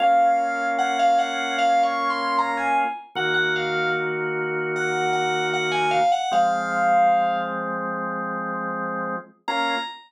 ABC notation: X:1
M:4/4
L:1/16
Q:1/4=76
K:Bbm
V:1 name="Electric Piano 2"
f4 g f g2 (3f2 d'2 c'2 b a z2 | g g f2 z4 g2 g2 g a f g | f6 z10 | b4 z12 |]
V:2 name="Drawbar Organ"
[B,DF]16 | [E,B,G]16 | [F,A,C]16 | [B,DF]4 z12 |]